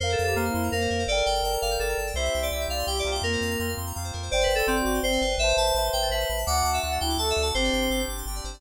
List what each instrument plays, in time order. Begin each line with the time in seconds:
0.00 synth bass 1 F2, ocarina A#4, electric piano 2 A#4 C5 F5
0.09 electric piano 2 A4 C5
0.18 synth bass 1 F2, electric piano 2 F5
0.24 ocarina G4, electric piano 2 A4 A#5
0.35 synth bass 1 F2, electric piano 2 A#3 A#4 C5 F5 C6
0.45 ocarina E4, electric piano 2 F6
0.54 synth bass 1 F2, electric piano 2 C6
0.63 electric piano 2 A#5
0.71 synth bass 1 F2, ocarina A#3, electric piano 2 A#4 C5 F5
0.81 electric piano 2 C5
0.90 synth bass 1 F2, electric piano 2 A#4
0.99 electric piano 2 C5
1.07 synth bass 1 G1, electric piano 2 A4 A#4 D5, ocarina A#4
1.12 electric piano 2 G5
1.17 electric piano 2 A#4
1.26 synth bass 1 G1, electric piano 2 D5 G5
1.35 electric piano 2 G5
1.42 synth bass 1 G1, electric piano 2 A4 A#4 D5 A5
1.47 electric piano 2 G5
1.53 electric piano 2 A#5
1.62 synth bass 1 G1, electric piano 2 F5 D6
1.71 electric piano 2 G6
1.79 synth bass 1 G1, electric piano 2 A4 A#4 D5 G5 D6
1.89 electric piano 2 A#5
1.98 synth bass 1 G1, electric piano 2 A5
2.07 electric piano 2 G5
2.14 synth bass 1 C2, electric piano 2 C4 E4 C5, ocarina E5
2.18 electric piano 2 G4
2.24 electric piano 2 E5
2.34 synth bass 1 C2, electric piano 2 G5
2.43 electric piano 2 D5 C6
2.51 synth bass 1 C2, electric piano 2 C4 E4 G4 E6, ocarina E5
2.61 electric piano 2 G6
2.68 synth bass 1 C2, ocarina D5, electric piano 2 F5 E6
2.78 electric piano 2 C6
2.86 synth bass 1 C2, electric piano 2 C4 E4 G4 G5, ocarina G4
2.96 electric piano 2 D5 E5
3.05 synth bass 1 C2, electric piano 2 A#3 C4 F4 C5
3.11 electric piano 2 E5 G5
3.22 synth bass 1 F2, ocarina A#3, electric piano 2 A#4
3.32 electric piano 2 C5
3.41 synth bass 1 F2, electric piano 2 F5
3.50 electric piano 2 A#5
3.59 synth bass 1 F2, electric piano 2 A#3 C4 F4 C6
3.68 electric piano 2 F6
3.77 synth bass 1 F2, electric piano 2 C6
3.86 electric piano 2 A#5
3.95 synth bass 1 F2, electric piano 2 A#3 C4 F4 F5
4.04 electric piano 2 C5
4.13 synth bass 1 F2, electric piano 2 A#4
4.22 electric piano 2 C5
4.30 synth bass 1 G1, ocarina C5, electric piano 2 C5 D5 G5
4.40 electric piano 2 B4 D5
4.48 synth bass 1 G1, electric piano 2 G5
4.55 electric piano 2 A4 C6, ocarina A4
4.67 synth bass 1 G1, electric piano 2 C4 C5 D5 G5 D6
4.76 ocarina F#4, electric piano 2 G6
4.85 synth bass 1 G1, electric piano 2 D6
4.94 electric piano 2 C6
5.03 synth bass 1 G1, ocarina C4, electric piano 2 C5 D5 G5
5.12 electric piano 2 D5
5.21 synth bass 1 G1, electric piano 2 B4
5.38 synth bass 1 A1, electric piano 2 B4 C5 E5, ocarina C5
5.42 electric piano 2 E5 A5
5.48 electric piano 2 C5
5.57 synth bass 1 A1, electric piano 2 E5 A5
5.66 electric piano 2 A5
5.75 synth bass 1 A1, electric piano 2 B4 C5 E5 B5
5.79 electric piano 2 A5
5.84 electric piano 2 C6
5.93 synth bass 1 A1, electric piano 2 G5 E6
6.02 electric piano 2 A6
6.10 synth bass 1 A1, electric piano 2 B4 C5 E5 E6
6.14 electric piano 2 A5
6.20 electric piano 2 C6
6.29 synth bass 1 A1, electric piano 2 B5
6.38 electric piano 2 A5
6.46 synth bass 1 D2, electric piano 2 A3 D4 D5 D6, ocarina F#5
6.50 electric piano 2 F#4
6.56 electric piano 2 F#5
6.64 synth bass 1 D2, electric piano 2 A5
6.74 electric piano 2 E5 D6
6.82 synth bass 1 D2, electric piano 2 A3 D4 F#4 F#6, ocarina F#5
6.92 electric piano 2 A6
7.00 synth bass 1 D2, ocarina E4, electric piano 2 G5 F#6
7.09 electric piano 2 D6
7.18 synth bass 1 D2, electric piano 2 A3 D4 A5, ocarina A4
7.22 electric piano 2 F#4
7.28 electric piano 2 E5 F#5
7.37 synth bass 1 D2, electric piano 2 D5
7.42 electric piano 2 F#5 A5
7.54 synth bass 1 G1, ocarina C4, electric piano 2 C4 D4 G4 C5
7.63 electric piano 2 D5
7.72 synth bass 1 G1, electric piano 2 G5
7.81 electric piano 2 C6
7.90 synth bass 1 G1, electric piano 2 C4 D4 G4 D6
7.99 electric piano 2 G6
8.08 synth bass 1 G1, electric piano 2 D6
8.17 electric piano 2 C6
8.26 synth bass 1 G1, electric piano 2 C4 D4 G4 G5
8.35 electric piano 2 D5
8.44 synth bass 1 G1, electric piano 2 C5
8.53 electric piano 2 D5